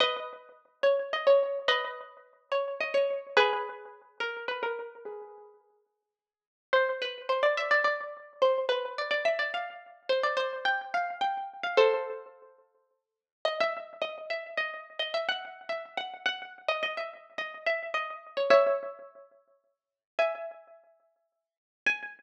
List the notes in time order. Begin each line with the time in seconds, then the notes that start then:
0.00 B4 D#5
0.83 C#5
1.13 D#5
1.27 C#5
1.68 B4 D#5
2.52 C#5
2.80 D#5
2.94 C#5
3.37 G#4 B4
4.20 A#4
4.48 B4
4.63 A#4
5.05 G#4 B4
6.73 C5
7.02 B4
7.29 C5
7.43 D5
7.57 E5
7.71 D5
7.84 D5
8.42 C5
8.69 B4
8.98 D5
9.11 D5
9.25 E5
9.39 D5
9.54 F5
10.09 C5
10.23 D5
10.37 C5
10.65 G5
10.94 F5
11.21 G5
11.63 F5
11.77 A4 C5
13.45 D#5
13.60 E5
14.02 D#5
14.30 E5
14.57 D#5
14.99 D#5
15.14 E5
15.29 F#5
15.69 E5
15.97 F#5
16.26 F#5
16.68 D#5
16.83 D#5
16.97 E5
17.38 D#5
17.66 E5
17.94 D#5
18.37 C#5
18.50 C#5 E5
20.19 E5 G#5
21.86 G#5